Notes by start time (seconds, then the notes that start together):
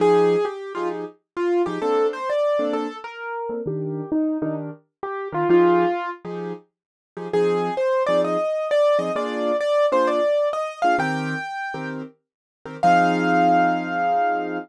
0.00 F3 D#4 G4 G#4
0.45 G4
0.75 F3 D#4 F4 G4 G#4
1.37 F4
1.66 F3 D#4 G4 G#4
1.82 A#3 C4 D4 A4
2.13 C5
2.30 D5
2.59 A#3 C4 D4 A4
2.73 A4
3.04 A#4
3.49 A#3 C4 D4 A4
3.66 D#3 D4 G4 A#4
4.12 D#4
4.42 D#3 D4 D#4 G4 A#4
5.03 G4
5.32 D#3 D4 F4 G4 A#4
5.49 F3 D#4 F4 G4 G#4
6.25 F3 D#4 G4 G#4
7.17 F3 D#4 G4 G#4
7.33 F3 C4 D#4 G#4
7.77 C5
8.06 F3 C4 D#4 G#4 D5
8.24 D#5
8.71 D5
8.99 F3 C4 D#4 G#4 D#5
9.16 A#3 D4 F4 G#4 D5
9.60 D5
9.92 A#3 D4 F4 G#4 C5
10.07 D5
10.53 D#5
10.82 A#3 D4 F4 G#4 F5
10.98 D#3 C4 G4 A#4 G5
11.74 D#3 C4 G4 A#4
12.66 D#3 C4 G4 A#4
12.83 F3 C4 D#4 G#4 F5